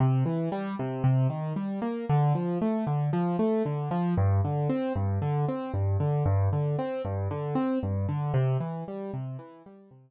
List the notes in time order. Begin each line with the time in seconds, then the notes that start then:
0.00 C3
0.26 E3
0.52 G3
0.79 C3
1.04 C3
1.30 D#3
1.56 G3
1.82 A#3
2.09 D3
2.35 F3
2.62 A3
2.87 D3
3.13 F3
3.39 A3
3.66 D3
3.91 F3
4.17 G2
4.44 D3
4.69 C4
4.96 G2
5.22 D3
5.48 C4
5.74 G2
6.00 D3
6.26 G2
6.53 D3
6.79 C4
7.05 G2
7.31 D3
7.55 C4
7.83 G2
8.09 D3
8.34 C3
8.60 E3
8.88 G3
9.14 C3
9.39 E3
9.66 G3
9.91 C3